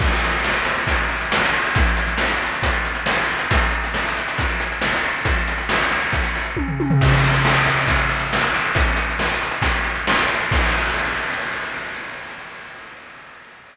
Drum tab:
CC |x---------------|----------------|----------------|----------------|
HH |-xxx-xxxxxxx-xxx|xxxx-xxxxxxx-xxx|xxxx-xxxxxxx-xxx|xxxx-xxxxxxx----|
SD |----o-------o---|----o-------o---|----o-------o---|----o-----------|
T1 |----------------|----------------|----------------|------------o-o-|
FT |----------------|----------------|----------------|-------------o-o|
BD |o-------o-------|o-------o-------|o-------o-------|o-------o---o---|

CC |x---------------|----------------|x---------------|
HH |-xxx-xxxxxxx-xxx|xxxx-xxxxxxx-xxx|----------------|
SD |----o-------o---|----o-------o---|----------------|
T1 |----------------|----------------|----------------|
FT |----------------|----------------|----------------|
BD |o-------o-------|o-------o-------|o---------------|